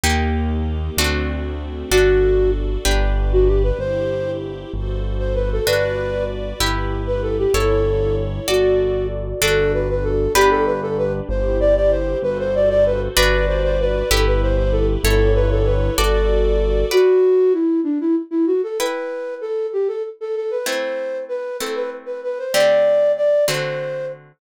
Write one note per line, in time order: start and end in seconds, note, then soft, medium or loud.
0.04 0.90 D#2 medium
0.04 0.88 A#3 loud
0.04 0.97 A#3 medium
0.04 0.88 D#4 loud
0.04 0.97 D#4 medium
0.04 0.88 G4 loud
0.04 0.97 G4 medium
0.97 1.84 D2 medium
0.97 1.91 A3 medium
0.97 1.83 A3 loud
0.97 1.91 C4 medium
0.97 1.83 C4 loud
0.97 1.91 D4 medium
0.97 1.83 D4 medium
0.97 1.91 F#4 medium
0.97 1.83 F#4 loud
1.91 2.78 G1 medium
1.91 2.76 D4 medium
1.91 2.84 D4 medium
1.91 2.51 F#4 medium
1.91 2.76 F#4 loud
1.91 2.84 F#4 medium
1.91 2.76 A4 loud
1.91 2.84 A4 medium
2.85 3.72 G1 medium
2.85 3.69 D4 medium
2.85 3.78 D4 medium
2.85 3.69 G4 medium
2.85 3.78 G4 medium
2.85 3.69 B4 loud
2.85 3.78 B4 medium
3.33 3.47 F#4 medium
3.48 3.62 G4 medium
3.63 3.78 B4 medium
3.79 4.65 G1 medium
3.79 4.72 E4 medium
3.79 4.72 G4 medium
3.79 4.31 C5 loud
3.79 4.72 C5 medium
4.73 5.60 G1 medium
4.73 5.66 F#4 medium
4.73 5.66 A4 medium
4.73 5.66 C5 medium
5.19 5.34 C5 medium
5.35 5.50 B4 medium
5.53 5.67 A4 loud
5.66 6.53 G1 medium
5.66 6.51 D4 loud
5.66 6.59 F#4 medium
5.66 6.51 F#4 loud
5.66 6.24 B4 loud
5.66 6.59 B4 medium
5.66 6.51 B4 loud
5.66 6.59 D5 medium
6.60 7.46 G1 medium
6.60 7.53 E4 medium
6.60 7.45 E4 loud
6.60 7.53 G4 medium
6.60 7.45 G4 medium
6.60 7.53 B4 medium
6.60 7.45 B4 medium
7.07 7.22 B4 medium
7.22 7.37 A4 medium
7.38 7.53 G4 medium
7.54 8.40 G1 medium
7.54 8.47 E4 medium
7.54 8.39 E4 medium
7.54 8.47 A4 medium
7.54 8.39 A4 medium
7.54 8.15 A4 loud
7.54 8.47 C#5 medium
7.54 8.39 C#5 medium
8.48 9.34 G1 medium
8.48 9.32 F#4 medium
8.48 9.41 F#4 medium
8.48 9.07 F#4 medium
8.48 9.32 A4 medium
8.48 9.41 A4 medium
8.48 9.32 D5 loud
8.48 9.41 D5 medium
9.41 10.28 G1 medium
9.41 10.34 D4 loud
9.41 10.26 D4 loud
9.41 10.34 F#4 loud
9.41 10.26 F#4 loud
9.41 10.34 A4 loud
9.41 9.72 A4 loud
9.41 10.26 A4 loud
9.74 9.88 B4 medium
9.89 10.04 B4 medium
10.04 10.33 A4 medium
10.35 11.21 G1 loud
10.35 11.20 D4 loud
10.35 11.28 D4 loud
10.35 10.50 G4 loud
10.35 11.20 G4 loud
10.35 11.28 G4 medium
10.35 11.20 B4 loud
10.35 11.28 B4 medium
10.51 10.65 A4 loud
10.66 10.81 B4 medium
10.82 10.97 A4 medium
10.98 11.13 B4 medium
11.29 12.15 G1 medium
11.29 12.22 E4 loud
11.29 12.22 G4 loud
11.29 12.22 C5 medium
11.29 11.58 C5 medium
11.60 11.75 D5 loud
11.76 11.91 D5 medium
11.91 12.18 C5 medium
12.22 13.09 G1 medium
12.22 13.16 F#4 medium
12.22 13.16 A4 medium
12.22 12.38 B4 loud
12.22 13.16 C5 medium
12.40 12.54 C5 loud
12.55 12.69 D5 medium
12.70 12.84 D5 loud
12.86 13.01 B4 loud
13.16 14.03 G1 medium
13.16 14.01 D4 loud
13.16 14.09 F#4 loud
13.16 14.01 F#4 loud
13.16 13.46 B4 loud
13.16 14.09 B4 loud
13.16 14.01 B4 loud
13.16 14.09 D5 loud
13.48 13.62 C5 medium
13.64 13.78 C5 loud
13.80 14.10 B4 loud
14.10 14.97 G1 medium
14.10 15.03 E4 loud
14.10 14.95 E4 loud
14.10 15.03 G4 medium
14.10 14.95 G4 loud
14.10 14.25 A4 loud
14.10 15.03 B4 medium
14.10 14.95 B4 loud
14.27 14.41 B4 medium
14.42 14.57 C5 medium
14.57 14.72 C5 medium
14.72 14.87 A4 loud
15.04 15.90 G1 loud
15.04 15.97 E4 medium
15.04 15.89 E4 loud
15.04 15.33 A4 loud
15.04 15.97 A4 medium
15.04 15.89 A4 loud
15.04 15.97 C#5 loud
15.04 15.89 C#5 loud
15.35 15.50 B4 loud
15.52 15.67 A4 loud
15.65 15.95 B4 medium
15.97 16.84 G1 medium
15.97 16.90 F#4 loud
15.97 16.82 F#4 loud
15.97 16.86 A4 loud
15.97 16.90 A4 medium
15.97 16.82 A4 loud
15.97 16.90 D5 loud
15.97 16.82 D5 loud
16.91 17.53 F#4 loud
16.91 18.60 B4 medium
16.91 18.60 D5 medium
16.91 18.60 F#5 medium
17.53 17.80 E4 medium
17.84 17.98 D4 medium
18.01 18.15 E4 medium
18.31 18.46 E4 medium
18.47 18.61 F#4 medium
18.63 18.78 A4 medium
18.79 20.49 E4 medium
18.79 19.35 B4 medium
18.79 20.49 B4 medium
18.79 20.49 G5 medium
19.41 19.67 A4 medium
19.73 19.88 G4 medium
19.88 20.03 A4 medium
20.21 20.35 A4 medium
20.36 20.51 A4 medium
20.51 20.66 B4 medium
20.66 21.51 A3 medium
20.66 21.51 C4 medium
20.66 21.51 E4 medium
20.66 21.18 C5 medium
21.29 21.57 B4 medium
21.60 22.45 A3 medium
21.60 22.45 C4 medium
21.60 22.45 E4 medium
21.60 21.75 A4 medium
21.75 21.90 B4 medium
22.06 22.21 B4 medium
22.24 22.38 B4 medium
22.39 22.54 C5 medium
22.53 23.38 D3 medium
22.53 23.38 A3 medium
22.53 23.38 C4 medium
22.53 23.38 G4 medium
22.53 23.12 D5 loud
23.17 23.45 D5 medium
23.48 24.32 D3 medium
23.48 24.32 A3 medium
23.48 24.32 C4 medium
23.48 24.32 F#4 medium
23.48 24.06 C5 medium